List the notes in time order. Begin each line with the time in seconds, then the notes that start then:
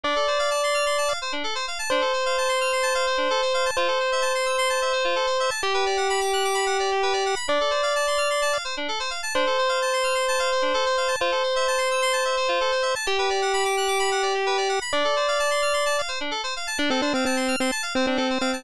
0.03 D4 D5
0.16 A4
0.27 C5
0.39 F5
0.51 A5
0.63 C6
0.74 F6
0.86 C6
0.98 A5
1.08 F5
1.22 C5
1.32 D4
1.44 A4
1.55 C5
1.68 F5
1.79 A5
1.90 D4 C5
2.01 A4
2.13 C5
2.26 F5
2.38 A5
2.49 C6
2.61 F6
2.73 C6
2.83 A5
2.95 F5
3.07 C5
3.17 D4
3.30 A4
3.42 C5
3.54 F5
3.66 A5
3.77 F4 C5
3.88 A4
4.00 C5
4.12 E5
4.22 A5
4.35 C6
4.46 E6
4.58 C6
4.70 A5
4.82 E5
4.93 C5
5.04 F4
5.16 A4
5.27 C5
5.40 E5
5.50 A5
5.62 G4
5.74 B4
5.86 D5
5.97 F#5
6.09 B5
6.21 D6
6.33 F#6
6.44 D6
6.54 B5
6.66 F#5
6.79 D5
6.91 G4
7.03 B4
7.13 D5
7.26 F#5
7.36 B5
7.48 D4 D5
7.61 A4
7.71 C5
7.83 F5
7.96 A5
8.07 C6
8.18 F6
8.30 C6
8.42 A5
8.53 F5
8.65 C5
8.77 D4
8.88 A4
9.00 C5
9.10 F5
9.23 A5
9.34 D4 C5
9.47 A4
9.58 C5
9.69 F5
9.82 A5
9.93 C6
10.04 F6
10.15 C6
10.28 A5
10.39 F5
10.52 C5
10.62 D4
10.74 A4
10.86 C5
10.97 F5
11.08 A5
11.20 F4 C5
11.32 A4
11.43 C5
11.56 E5
11.68 A5
11.78 C6
11.91 E6
12.02 C6
12.13 A5
12.25 E5
12.37 C5
12.48 F4
12.61 A4
12.72 C5
12.82 E5
12.95 A5
13.06 G4
13.18 B4
13.30 D5
13.42 F#5
13.53 B5
13.65 D6
13.77 F#6
13.88 D6
13.99 B5
14.11 F#5
14.22 D5
14.34 G4
14.46 B4
14.57 D5
14.69 F#5
14.81 B5
14.92 D4 D5
15.04 A4
15.16 C5
15.28 F5
15.39 A5
15.51 C6
15.62 F6
15.73 C6
15.86 A5
15.98 F5
16.08 C5
16.20 D4
16.31 A4
16.44 C5
16.56 F5
16.67 A5
16.78 D4
16.90 C4 A4
17.02 D4 C5
17.14 C4 F5
17.25 C4 A5
17.37 C6
17.48 F6
17.60 C4 C6
17.71 A5
17.83 F5
17.95 C4 C5
18.07 C4 D4
18.17 C4 A4
18.30 C5
18.41 C4 F5
18.53 A5